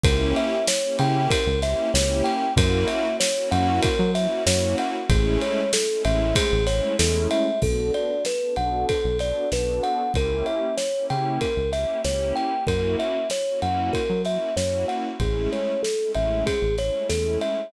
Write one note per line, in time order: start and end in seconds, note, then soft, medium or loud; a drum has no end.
0.03 0.33 C#2 loud
0.03 0.55 A#3 loud
0.03 0.55 C#4 loud
0.03 0.55 E4 loud
0.03 0.55 G4 medium
0.03 0.33 A#4 medium
0.03 kick loud
0.03 ride loud
0.36 0.66 E5 medium
0.36 ride medium
0.68 0.97 C#5 medium
0.68 snare loud
0.83 1.33 A#3 medium
0.83 1.33 C#4 medium
0.83 1.33 E4 medium
0.83 1.33 G4 medium
0.99 1.28 C#3 loud
0.99 1.29 G5 medium
0.99 ride medium
1.30 1.59 A#4 medium
1.30 kick medium
1.30 ride loud
1.46 1.75 C#2 medium
1.62 1.88 A#3 loud
1.62 1.88 C#4 medium
1.62 1.88 E4 medium
1.62 1.88 G4 medium
1.62 1.92 E5 medium
1.62 snare medium
1.62 ride medium
1.94 2.22 C#2 medium
1.94 2.45 A#3 medium
1.94 2.45 C#4 medium
1.94 2.45 E4 medium
1.94 2.45 G4 medium
1.94 2.23 C#5 medium
1.94 snare loud
2.24 2.53 G5 medium
2.24 ride medium
2.56 2.85 F#2 loud
2.56 3.07 A#3 loud
2.56 3.07 C#4 medium
2.56 3.07 E4 loud
2.56 3.07 F#4 medium
2.56 2.88 A#4 medium
2.56 kick loud
2.56 ride loud
2.88 3.17 E5 medium
2.88 ride medium
3.20 3.49 C#5 medium
3.20 snare loud
3.36 3.86 A#3 medium
3.36 3.86 C#4 loud
3.36 3.86 E4 medium
3.36 3.86 F#4 medium
3.51 3.80 F#2 medium
3.51 3.80 F#5 medium
3.51 ride medium
3.82 4.11 A#4 medium
3.82 kick medium
3.82 ride medium
3.99 4.27 F#3 medium
4.15 4.41 A#3 medium
4.15 4.41 C#4 medium
4.15 4.41 E4 medium
4.15 4.41 F#4 medium
4.15 4.44 E5 medium
4.15 snare soft
4.15 ride medium
4.45 4.75 F#2 medium
4.45 4.95 A#3 medium
4.45 4.95 C#4 medium
4.45 4.95 E4 medium
4.45 4.95 F#4 medium
4.45 4.76 C#5 medium
4.45 snare loud
4.78 5.08 F#5 medium
4.78 ride medium
5.09 5.38 A1 loud
5.09 5.61 G#3 loud
5.09 5.61 A3 loud
5.09 5.61 C#4 loud
5.09 5.61 E4 medium
5.09 5.40 G#4 medium
5.09 kick medium
5.09 ride medium
5.41 5.71 C#5 medium
5.41 ride medium
5.73 6.03 A4 medium
5.73 snare loud
5.90 6.40 G#3 medium
5.90 6.40 A3 medium
5.90 6.40 C#4 medium
5.90 6.40 E4 medium
6.05 6.33 A1 medium
6.05 6.34 E5 medium
6.05 ride medium
6.36 6.65 G#4 medium
6.36 kick medium
6.36 ride loud
6.52 6.81 A1 medium
6.67 6.92 G#3 medium
6.67 6.92 A3 medium
6.67 6.92 C#4 medium
6.67 6.92 E4 medium
6.67 6.96 C#5 medium
6.67 snare medium
6.67 ride medium
6.98 7.28 E2 medium
6.98 7.48 G#3 medium
6.98 7.48 A3 medium
6.98 7.48 C#4 medium
6.98 7.48 E4 medium
6.98 7.28 A4 medium
6.98 snare loud
7.31 7.60 E5 medium
7.31 ride medium
7.61 7.91 B1 medium
7.61 8.12 B3 medium
7.61 8.12 D4 medium
7.61 8.12 F#4 medium
7.61 8.12 A4 medium
7.61 7.92 A4 medium
7.61 kick medium
7.61 crash medium
7.94 8.23 D5 medium
7.94 ride soft
8.25 8.55 B4 medium
8.25 snare medium
8.42 8.92 B3 medium
8.42 8.92 D4 medium
8.42 8.92 F#4 medium
8.42 8.92 A4 medium
8.56 8.85 B1 medium
8.56 8.86 F#5 medium
8.56 ride medium
8.89 9.18 A4 medium
8.89 kick medium
8.89 ride medium
9.04 9.33 B1 medium
9.19 9.44 B3 medium
9.19 9.44 D4 medium
9.19 9.44 F#4 medium
9.19 9.44 A4 medium
9.19 9.49 D5 medium
9.19 snare soft
9.19 ride medium
9.52 9.80 B1 medium
9.52 10.02 B3 medium
9.52 10.02 D4 medium
9.52 10.02 F#4 medium
9.52 10.02 A4 medium
9.52 9.82 B4 medium
9.52 snare medium
9.83 10.12 F#5 medium
9.83 ride medium
10.14 10.43 C#2 medium
10.14 10.66 A#3 medium
10.14 10.66 C#4 medium
10.14 10.66 E4 medium
10.14 10.66 G4 medium
10.14 10.46 A#4 medium
10.14 kick medium
10.14 ride medium
10.46 10.75 E5 medium
10.46 ride soft
10.78 11.06 C#5 medium
10.78 snare medium
10.94 11.45 A#3 medium
10.94 11.45 C#4 medium
10.94 11.45 E4 medium
10.94 11.45 G4 medium
11.10 11.39 C#3 medium
11.10 11.39 G5 medium
11.10 ride medium
11.41 11.70 A#4 medium
11.41 kick medium
11.41 ride medium
11.57 11.85 C#2 medium
11.73 11.98 A#3 medium
11.73 11.98 C#4 medium
11.73 11.98 E4 medium
11.73 11.98 G4 medium
11.73 12.02 E5 medium
11.73 snare soft
11.73 ride medium
12.03 12.33 C#2 medium
12.03 12.54 A#3 medium
12.03 12.54 C#4 medium
12.03 12.54 E4 medium
12.03 12.54 G4 medium
12.03 12.34 C#5 medium
12.03 snare medium
12.36 12.65 G5 medium
12.36 ride soft
12.67 12.96 F#2 medium
12.67 13.17 A#3 medium
12.67 13.17 C#4 medium
12.67 13.17 E4 medium
12.67 13.17 F#4 medium
12.67 12.96 A#4 medium
12.67 kick medium
12.67 ride medium
12.99 13.28 E5 medium
12.99 ride medium
13.30 13.60 C#5 medium
13.30 snare medium
13.48 13.98 A#3 medium
13.48 13.98 C#4 medium
13.48 13.98 E4 medium
13.48 13.98 F#4 medium
13.62 13.91 F#2 medium
13.62 13.91 F#5 medium
13.62 ride medium
13.93 14.22 A#4 medium
13.93 kick medium
13.93 ride medium
14.10 14.38 F#3 medium
14.24 14.50 A#3 medium
14.24 14.50 C#4 medium
14.24 14.50 E4 medium
14.24 14.50 F#4 medium
14.24 14.55 E5 medium
14.24 snare soft
14.24 ride soft
14.56 14.85 F#2 medium
14.56 15.08 A#3 medium
14.56 15.08 C#4 medium
14.56 15.08 E4 medium
14.56 15.08 F#4 medium
14.56 14.86 C#5 medium
14.56 snare medium
14.88 15.17 F#5 medium
14.88 ride soft
15.20 15.48 A1 medium
15.20 15.72 G#3 medium
15.20 15.72 A3 medium
15.20 15.72 C#4 medium
15.20 15.72 E4 medium
15.20 15.50 G#4 medium
15.20 kick medium
15.20 ride medium
15.52 15.81 C#5 medium
15.52 ride soft
15.83 16.12 A4 medium
15.83 snare medium
15.99 16.50 G#3 medium
15.99 16.50 A3 medium
15.99 16.50 C#4 medium
15.99 16.50 E4 medium
16.14 16.44 A1 medium
16.14 16.44 E5 medium
16.14 ride medium
16.46 16.75 G#4 medium
16.46 kick medium
16.46 ride medium
16.62 16.91 A1 medium
16.78 17.04 G#3 medium
16.78 17.04 A3 medium
16.78 17.04 C#4 medium
16.78 17.04 E4 medium
16.78 17.08 C#5 medium
16.78 snare soft
16.78 ride soft
17.09 17.38 E2 medium
17.09 17.60 G#3 medium
17.09 17.60 A3 medium
17.09 17.60 C#4 medium
17.09 17.60 E4 medium
17.09 17.38 A4 medium
17.09 snare medium
17.41 17.70 E5 medium
17.41 ride medium